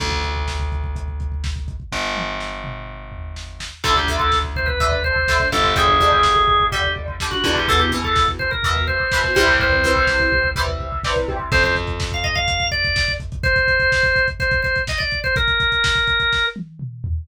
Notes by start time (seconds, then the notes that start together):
0.00 D2, kick, crash
0.12 kick
0.23 kick, closed hi-hat
0.36 kick
0.48 kick, snare
0.60 kick
0.72 kick, closed hi-hat
0.84 kick
0.96 kick, closed hi-hat
1.08 kick
1.20 kick, closed hi-hat
1.32 kick
1.44 kick, snare
1.56 kick
1.68 kick, closed hi-hat
1.80 kick
1.92 G1, kick, snare
2.16 high tom
2.40 snare
2.64 mid tom
3.12 floor tom
3.36 snare
3.60 snare
3.84 D2 D3 A3 A4, kick, crash
3.96 G4, kick
4.08 D3 A3, kick, floor tom
4.19 A4, kick
4.32 kick, snare
4.44 kick
4.56 C5, kick, floor tom
4.66 B4, kick
4.80 D3 A3, kick, floor tom
4.92 kick
5.04 C5, kick, floor tom
5.16 kick
5.28 D3 A3, kick, snare
5.40 kick
5.51 G1 D3 A3 A4, kick, floor tom
5.64 kick
5.75 D3 G3 G#4, kick, floor tom
5.88 kick
6.00 D3 G3, kick, floor tom
6.12 kick
6.23 kick, snare
6.36 kick
6.48 kick, floor tom
6.60 kick
6.72 D3 G3 G4, kick, floor tom
6.84 kick
6.96 kick, floor tom
7.08 kick
7.20 D3 G3, kick, snare
7.31 F#4, kick
7.44 E2 D3 G3, kick, floor tom
7.56 G4, kick
7.68 B2 E3 A4, kick, floor tom
7.79 G4, kick
7.91 B2 E3, kick, floor tom
8.04 A4, kick
8.16 kick, snare
8.28 kick
8.39 C5, kick, floor tom
8.51 A#4, kick
8.63 B2 E3, kick, floor tom
8.76 kick
8.87 C5, kick, floor tom
9.00 kick
9.12 B2 E3, kick, snare
9.24 kick
9.35 C2 C3 E3 G3 C5, kick, floor tom
9.48 kick
9.60 C5, kick, floor tom
9.72 kick
9.83 C3 E3 G3, kick, floor tom
9.96 kick
10.07 kick, snare
10.20 kick
10.32 kick, floor tom
10.44 kick
10.56 C3 E3 G3, kick, floor tom
10.68 kick
10.80 kick, floor tom
10.92 kick
11.04 C3 E3 G3, kick, snare
11.16 kick
11.28 C3 E3 G3, kick, floor tom
11.39 kick
11.52 F2 C5, kick, crash
11.64 C5, kick, closed hi-hat
11.76 kick, closed hi-hat
11.87 kick, closed hi-hat
12.00 kick, snare
12.11 F5, kick, closed hi-hat
12.24 D#5, kick, closed hi-hat
12.35 F5, kick, closed hi-hat
12.48 kick, closed hi-hat
12.60 kick, closed hi-hat
12.71 D5, kick, closed hi-hat
12.84 kick, closed hi-hat
12.96 kick, snare
13.08 kick, closed hi-hat
13.20 kick, closed hi-hat
13.32 kick, closed hi-hat
13.43 C5, kick, closed hi-hat
13.56 kick, closed hi-hat
13.68 kick, closed hi-hat
13.80 kick, closed hi-hat
13.92 kick, snare
14.03 kick, closed hi-hat
14.16 kick, closed hi-hat
14.28 kick, closed hi-hat
14.40 C5, kick, closed hi-hat
14.51 kick, closed hi-hat
14.62 C5, kick, closed hi-hat
14.76 kick, closed hi-hat
14.87 D#5, kick, snare
14.98 D5, kick, closed hi-hat
15.11 kick, closed hi-hat
15.24 C5, kick, closed hi-hat
15.36 A#4, kick, closed hi-hat
15.48 kick, closed hi-hat
15.60 kick, closed hi-hat
15.72 kick, closed hi-hat
15.84 kick, snare
15.95 kick, closed hi-hat
16.07 kick, closed hi-hat
16.20 kick, closed hi-hat
16.33 kick, snare
16.56 high tom
16.79 mid tom
17.04 floor tom